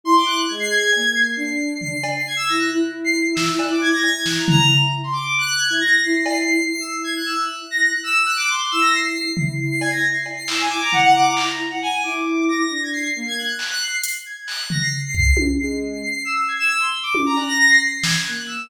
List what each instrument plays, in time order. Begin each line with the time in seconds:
0.04 violin E4 C6
0.16 violin D6
0.26 violin F#6
0.48 violin G#3 G#6
0.60 violin C7
0.69 violin G#6
0.92 violin A#3, cowbell
1.15 violin C7
1.36 violin D4 C7
1.81 violin C7, floor tom
2.04 cowbell
2.16 violin C7
2.27 violin G#6
2.36 violin E6
2.48 violin E4 A#6
2.59 violin F#6
2.71 violin E4
3.04 violin C7
3.35 violin E6, snare
3.48 violin E6
3.59 violin F#6, cowbell
3.71 violin D6
3.81 violin G#6
3.93 violin A#6
4.02 violin E4 G#6, cowbell
4.26 violin F#6, snare
4.37 violin A#5
4.48 violin A#5, floor tom
5.04 violin C6
5.13 violin D6
5.38 violin F#6
5.57 violin G#6
5.69 violin E4 G#6
5.81 violin A#6
6.02 violin E4 C7
6.15 violin C7
6.26 violin C7, cowbell
6.37 violin C7
6.48 violin C7
6.70 violin E4 C7
6.80 violin E6
6.91 violin C7
7.04 violin G#6
7.16 violin F#6
7.26 violin E6
7.37 violin F#6
7.71 violin A#6
7.82 violin F#6
8.04 violin E6
8.26 violin F#6
8.36 violin D6
8.49 violin C6
8.71 violin E4 E6
8.81 violin A#6
8.94 violin C7
9.03 violin C7
9.13 violin C7
9.37 violin E4 C7, floor tom
9.60 violin C7
9.70 violin C7
9.81 violin G#6, cowbell
9.91 violin A#6
10.14 violin C7
10.26 cowbell
10.37 violin C7
10.47 violin E4 E6, clap
10.60 violin G#5
10.69 violin E4 D6
10.82 violin A#5
10.92 violin F#5, floor tom
11.03 violin F#5
11.16 violin D6
11.26 violin A#5
11.37 clap
11.70 violin F#5
11.82 violin G#5
12.03 violin E4 D6
12.49 violin A#6
12.69 violin D4
12.83 violin G#6
12.93 violin C7
13.03 violin C7
13.15 violin A#3 C7
13.27 violin G#6
13.38 violin F#6
13.49 violin F#6
13.58 violin F#6, clap
13.70 violin F#6
13.81 violin C7
13.91 violin C7
14.04 closed hi-hat
14.26 violin G#6
14.47 violin F#6, clap
14.70 violin A#6, floor tom
14.82 violin C7
15.05 violin C7
15.14 violin C7, kick
15.25 violin C7
15.37 violin C7, high tom
15.60 violin G#3 C7
15.92 violin C7
16.03 violin C7
16.14 violin C7
16.25 violin E6
16.35 violin C7
16.48 violin G#6
16.59 violin E6
16.79 violin C6
17.03 violin D6
17.15 high tom
17.26 violin A#5
17.37 violin F#6, cowbell
17.47 violin A#6
17.59 violin A#6
17.69 violin C7
17.82 violin C7
17.93 violin C7
18.02 violin G#6, snare
18.26 violin A#3 F#6
18.47 violin E6